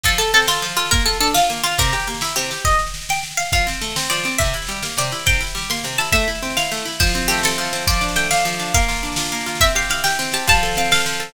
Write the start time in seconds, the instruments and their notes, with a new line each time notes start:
0.04 orchestral harp F3, pizzicato strings A4, kick, snare
0.12 snare
0.18 pizzicato strings A4, orchestral harp A4, snare
0.28 snare
0.33 orchestral harp C4, pizzicato strings A4, snare
0.42 snare
0.47 pizzicato strings F4, orchestral harp A4, snare
0.55 snare
0.62 orchestral harp F3, snare
0.69 snare
0.77 pizzicato strings F4, orchestral harp A4, snare
0.86 snare
0.91 orchestral harp A#3, pizzicato strings A#4, kick, snare
0.99 snare
1.06 orchestral harp F4, pizzicato strings A4, snare
1.13 snare
1.20 orchestral harp D4, pizzicato strings A4, snare
1.27 snare
1.34 pizzicato strings F4, orchestral harp F4, snare
1.42 snare
1.50 orchestral harp A#3, snare
1.56 snare
1.64 pizzicato strings F4, orchestral harp F4, snare
1.71 snare
1.78 orchestral harp C3, pizzicato strings A#4, kick, snare
1.87 snare
1.93 orchestral harp G4, snare
2.00 snare
2.07 orchestral harp A#3, snare
2.14 snare
2.21 orchestral harp E4, snare
2.29 snare
2.36 orchestral harp C3, pizzicato strings G4, snare
2.44 snare
2.51 orchestral harp G4, snare
2.58 snare
2.65 pizzicato strings D#5, kick, snare
2.71 snare
2.79 snare
2.87 snare
2.94 snare
3.01 snare
3.09 pizzicato strings G5, snare
3.16 snare
3.23 snare
3.31 snare
3.37 pizzicato strings F5, snare
3.45 snare
3.52 orchestral harp F3, pizzicato strings F5, kick, snare
3.58 snare
3.67 orchestral harp C4, snare
3.73 snare
3.81 orchestral harp A3, snare
3.90 snare
3.96 orchestral harp C4, snare
4.04 snare
4.10 orchestral harp F3, pizzicato strings D5, snare
4.17 snare
4.24 orchestral harp C4, snare
4.32 snare
4.38 orchestral harp C3, pizzicato strings E5, kick, snare
4.45 snare
4.53 orchestral harp E4, snare
4.62 snare
4.67 orchestral harp G3, snare
4.76 snare
4.83 orchestral harp A#3, snare
4.90 snare
4.97 orchestral harp C3, pizzicato strings D5, snare
5.04 snare
5.12 orchestral harp E4, snare
5.19 snare
5.26 orchestral harp C3, pizzicato strings G5, kick, snare
5.33 snare
5.41 orchestral harp E4, snare
5.47 snare
5.55 orchestral harp G3, snare
5.61 snare
5.70 orchestral harp A#3, pizzicato strings C6, snare
5.77 snare
5.84 orchestral harp C3, snare
5.93 snare
5.98 orchestral harp E4, pizzicato strings A5, snare
6.04 snare
6.12 orchestral harp A3, pizzicato strings E5, kick, snare
6.20 snare
6.28 orchestral harp E4, snare
6.35 snare
6.43 orchestral harp C4, snare
6.50 snare
6.57 orchestral harp E4, pizzicato strings F5, snare
6.64 snare
6.71 orchestral harp A3, snare
6.77 snare
6.85 orchestral harp E4, snare
6.92 snare
6.99 orchestral harp F3, pizzicato strings C5, kick, snare
7.07 snare
7.14 orchestral harp C4, snare
7.22 snare
7.28 orchestral harp A3, pizzicato strings G4, snare
7.37 snare
7.43 orchestral harp C4, pizzicato strings A4, snare
7.51 snare
7.58 orchestral harp F3, snare
7.65 snare
7.73 orchestral harp C4, snare
7.82 snare
7.87 orchestral harp F3, pizzicato strings D5, kick, snare
7.93 snare
8.01 orchestral harp D4, snare
8.08 snare
8.16 orchestral harp A3, pizzicato strings G5, snare
8.24 snare
8.31 orchestral harp D4, pizzicato strings F5, snare
8.36 snare
8.45 orchestral harp F3, snare
8.52 snare
8.59 orchestral harp D4, snare
8.66 snare
8.74 orchestral harp A#3, pizzicato strings F5, kick, snare
8.80 snare
8.88 orchestral harp F4, snare
8.96 snare
9.03 orchestral harp D4, snare
9.12 snare
9.16 orchestral harp F4, snare
9.25 snare
9.32 orchestral harp A#3, snare
9.41 snare
9.46 orchestral harp F4, snare
9.55 snare
9.61 orchestral harp C4, pizzicato strings E5, kick, snare
9.68 snare
9.75 orchestral harp G4, pizzicato strings F5, snare
9.82 snare
9.90 orchestral harp E4, pizzicato strings F5, snare
9.97 snare
10.04 orchestral harp G4, pizzicato strings G5, snare
10.10 snare
10.19 orchestral harp C4, snare
10.25 snare
10.32 orchestral harp G4, pizzicato strings A5, snare
10.39 snare
10.47 orchestral harp F3, pizzicato strings A5, kick, snare
10.54 snare
10.63 orchestral harp A4, snare
10.71 snare
10.75 orchestral harp C4, pizzicato strings F5, snare
10.85 snare
10.91 orchestral harp A4, pizzicato strings F5, snare
10.99 snare
11.06 orchestral harp F3, snare
11.13 snare
11.20 orchestral harp A4, snare
11.28 snare